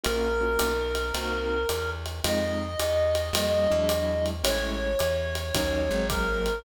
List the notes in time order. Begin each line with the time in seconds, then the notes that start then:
0.04 A#1 A#3 C#4 F4 F#4 A#4, ride
0.41 A#3 C#4 F4 F#4
0.59 B1, hi-hat pedal, ride
0.95 ride
1.14 C2 A#3 C4 D#4 F#4, ride
1.69 E2, hi-hat pedal, ride
2.06 ride
2.24 F2 G#3 C4 D#4 F4 D#5, ride
2.79 E2, hi-hat pedal, ride
3.15 ride
3.33 F2 G3 A#3 C#4 F4, ride
3.70 E2 F#3 G#3 D4 E4
3.89 hi-hat pedal, ride
4.26 ride
4.43 A1 G#3 A3 C#4 E4 C#5, ride
4.99 E2, hi-hat pedal, ride
5.35 ride
5.54 D#2 F#3 A#3 C#4 D#4, kick, ride
5.89 G#1 F#3 G#3 A#3 C4
6.10 A#4, kick, hi-hat pedal, ride
6.46 ride